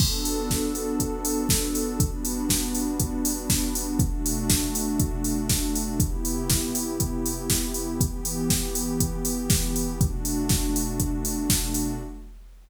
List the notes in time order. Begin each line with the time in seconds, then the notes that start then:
0.00 B3 D4 F#4 A4, kick, crash
0.25 open hi-hat
0.51 kick, snare
0.75 open hi-hat
1.00 kick, closed hi-hat
1.25 open hi-hat
1.49 kick, snare
1.75 open hi-hat
2.00 G3 B3 D4 F#4, kick, closed hi-hat
2.25 open hi-hat
2.49 kick, snare
2.75 open hi-hat
3.00 kick, closed hi-hat
3.25 open hi-hat
3.50 kick, snare
3.75 open hi-hat
3.99 B2 A3 D4 F#4, kick, closed hi-hat
4.26 open hi-hat
4.50 kick, snare
4.75 open hi-hat
4.99 kick, closed hi-hat
5.24 open hi-hat
5.49 kick, snare
5.76 open hi-hat
5.99 C3 B3 E4 G4, kick, closed hi-hat
6.25 open hi-hat
6.50 kick, snare
6.75 open hi-hat
7.00 kick, closed hi-hat
7.26 open hi-hat
7.50 kick, snare
7.74 open hi-hat
8.00 E3 B3 G4, kick, closed hi-hat
8.25 open hi-hat
8.50 kick, snare
8.75 open hi-hat
9.00 kick, closed hi-hat
9.25 open hi-hat
9.50 kick, snare
9.76 open hi-hat
10.00 B2 A3 D4 F#4, kick, closed hi-hat
10.25 open hi-hat
10.49 kick, snare
10.76 open hi-hat
11.00 kick, closed hi-hat
11.25 open hi-hat
11.50 kick, snare
11.74 open hi-hat